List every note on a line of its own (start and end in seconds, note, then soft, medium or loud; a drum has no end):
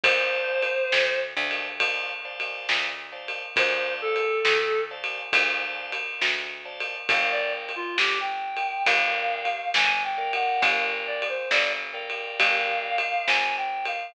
0.03 0.79 D2 medium
0.03 1.19 C5 medium
0.03 0.67 C5 medium
0.03 0.67 D5 medium
0.03 0.67 F5 medium
0.03 0.67 A5 medium
0.03 kick loud
0.03 ride loud
0.63 ride medium
0.92 1.34 D2 medium
0.92 snare loud
1.37 2.56 D2 medium
1.37 1.68 C5 medium
1.37 1.68 D5 medium
1.37 1.68 F5 medium
1.37 1.68 A5 medium
1.51 ride medium
1.80 2.12 C5 medium
1.80 2.12 D5 medium
1.80 2.12 F5 medium
1.80 2.12 A5 medium
1.80 kick medium
1.80 ride loud
2.25 2.87 C5 medium
2.25 2.87 D5 medium
2.25 2.87 F5 medium
2.25 2.87 A5 medium
2.40 ride medium
2.69 3.44 D2 medium
2.69 snare loud
3.12 3.43 C5 medium
3.12 3.43 D5 medium
3.12 3.43 F5 medium
3.12 3.43 A5 medium
3.28 ride medium
3.56 4.32 D2 medium
3.56 3.93 C5 medium
3.56 4.19 C5 medium
3.56 4.19 D5 medium
3.56 4.19 F5 medium
3.56 4.19 A5 medium
3.56 kick loud
3.56 ride loud
4.01 4.83 A4 medium
4.16 ride medium
4.45 5.20 D2 medium
4.45 snare loud
4.91 5.22 C5 medium
4.91 5.22 D5 medium
4.91 5.22 F5 medium
4.91 5.22 A5 medium
5.04 ride medium
5.33 6.08 D2 loud
5.33 5.94 C5 medium
5.33 5.94 D5 medium
5.33 5.94 F5 medium
5.33 5.94 A5 medium
5.33 kick loud
5.33 ride loud
5.92 ride medium
6.21 6.96 D2 medium
6.21 snare loud
6.65 6.96 C5 medium
6.65 6.96 D5 medium
6.65 6.96 F5 medium
6.65 6.96 A5 medium
6.80 ride medium
7.09 7.84 G1 medium
7.09 7.72 A#4 medium
7.09 7.72 D5 medium
7.09 7.31 F5 medium
7.09 7.72 F5 medium
7.09 7.72 G5 medium
7.09 kick loud
7.09 ride loud
7.32 7.53 D5 medium
7.69 ride medium
7.76 7.97 F4 medium
7.97 8.73 G1 medium
7.97 8.18 G4 medium
7.97 snare loud
8.21 8.83 G5 medium
8.57 ride medium
8.86 9.61 G1 loud
8.86 9.49 A#4 medium
8.86 9.49 D5 medium
8.86 9.68 F5 medium
8.86 9.49 F5 medium
8.86 9.49 G5 medium
8.86 kick medium
8.86 ride loud
9.45 ride medium
9.74 10.49 G1 medium
9.74 10.03 G#5 medium
9.74 snare loud
10.04 10.32 G5 medium
10.18 11.24 A#4 medium
10.18 11.24 D5 medium
10.18 11.24 F5 medium
10.18 11.24 G5 medium
10.33 10.62 F#5 medium
10.33 ride medium
10.62 11.37 G1 loud
10.62 10.83 F5 medium
10.62 kick loud
10.62 ride loud
11.07 11.28 D5 medium
11.22 ride medium
11.29 11.50 C5 medium
11.51 12.26 G1 medium
11.51 11.72 D5 medium
11.51 snare loud
11.94 12.99 A#4 medium
11.94 12.99 D5 medium
11.94 12.99 F5 medium
11.94 12.99 G5 medium
12.10 ride medium
12.39 13.15 G1 medium
12.39 13.25 F5 medium
12.39 kick loud
12.39 ride loud
12.98 ride loud
13.27 14.03 G1 medium
13.27 13.55 G#5 medium
13.27 snare loud
13.57 13.85 G5 medium
13.85 14.14 F5 medium
13.85 ride medium